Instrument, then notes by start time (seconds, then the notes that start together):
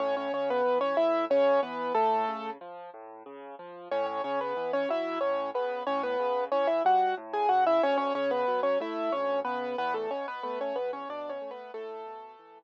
acoustic grand piano
0.00 A2 C#4 C#5
0.17 C#4 C#5
0.33 C#3 C#4 C#5
0.50 B3 B4
0.65 E3
0.81 C#4 C#5
0.97 A2 E4 E5
1.30 C#3 C#4 C#5
1.63 E3 B3 B4
1.95 A2 A3 A4
2.28 C#3
2.61 F3
2.94 A2
3.26 C#3
3.59 F3
3.91 A2 C#4 C#5
4.06 C#4 C#5
4.24 C#3 C#4 C#5
4.41 B3 B4
4.57 E3
4.73 C#4 C#5
4.89 F#3 E4 E5
5.21 A2 C#4 C#5
5.54 C#3 B3 B4
5.87 A2 C#4 C#5
6.03 B3 B4
6.20 C#3
6.52 E3 C#4 C#5
6.67 E4 E5
6.85 G3 F#4 F#5
7.17 A2
7.33 G#4 G#5
7.49 C#3 F#4 F#5
7.67 E4 E5
7.83 D2 C#4 C#5
7.98 C#4 C#5
8.15 C#3 C#4 C#5
8.31 B3 B4
8.48 F#3
8.63 C#4 C#5
8.80 A3 E4 E5
9.12 D2 C#4 C#5
9.45 C#3 B3 B4
9.78 E2 B3 B4
9.94 A3 A4
10.11 B2 C#4 C#5
10.28 B3 B4
10.43 A3 B3 B4
10.61 C#4 C#5
10.76 E2 B3 B4
10.93 C#4 C#5
11.09 B2 D4 D5
11.29 C#4 C#5
11.41 A3
11.51 B3 B4
11.74 A2 A3 A4
12.06 B2
12.39 E3